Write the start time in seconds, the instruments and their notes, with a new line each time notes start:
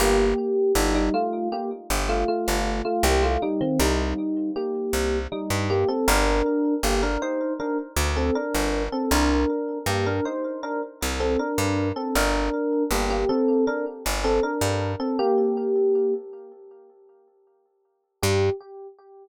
0.00 electric bass (finger) G1, electric piano 1 A#3 G4
0.75 electric bass (finger) G1, electric piano 1 G3 D#4
0.95 electric piano 1 G3 D#4
1.14 electric piano 1 A3 F4
1.52 electric piano 1 A#3 G4
1.90 electric bass (finger) G1
2.09 electric piano 1 A3 F4
2.28 electric piano 1 A3 F4
2.48 electric bass (finger) G1
2.85 electric piano 1 A3 F4
3.03 electric bass (finger) C2, electric piano 1 A#3 G4
3.23 electric piano 1 A3 F4
3.42 electric piano 1 G3 D#4
3.61 electric piano 1 D#3 C4
3.80 electric bass (finger) C2, electric piano 1 G3 D#4
4.56 electric piano 1 A#3 G4
4.93 electric bass (finger) C2
5.32 electric piano 1 G3 D#4
5.50 electric bass (finger) G2
5.70 electric piano 1 A#3 G4
5.88 electric piano 1 C4 A4
6.08 electric bass (finger) G1, electric piano 1 D4 A#4
6.83 electric bass (finger) G1, electric piano 1 A#3 G4
7.03 electric piano 1 D4 A#4
7.22 electric piano 1 D#4 C5
7.60 electric piano 1 D4 A#4
7.97 electric bass (finger) D2
8.16 electric piano 1 C4 A4
8.35 electric piano 1 D4 A#4
8.54 electric bass (finger) G1
8.92 electric piano 1 C4 A4
9.11 electric bass (finger) C2, electric piano 1 D4 A#4
9.86 electric bass (finger) G2, electric piano 1 A#3 G4
10.06 electric piano 1 D4 A#4
10.25 electric piano 1 D#4 C5
10.63 electric piano 1 D4 A#4
11.02 electric bass (finger) C2
11.20 electric piano 1 C4 A4
11.39 electric piano 1 D4 A#4
11.58 electric bass (finger) G2
11.96 electric piano 1 C4 A4
12.15 electric bass (finger) G1, electric piano 1 D4 A#4
12.91 electric bass (finger) G1, electric piano 1 A#3 G4
13.10 electric piano 1 A#3 G4
13.29 electric piano 1 C4 A4
13.67 electric piano 1 D4 A#4
14.06 electric bass (finger) G1
14.24 electric piano 1 C4 A4
14.43 electric piano 1 D4 A#4
14.61 electric bass (finger) G2
15.00 electric piano 1 C4 A4
15.19 electric piano 1 A#3 G4
18.22 electric bass (finger) G2, electric piano 1 G4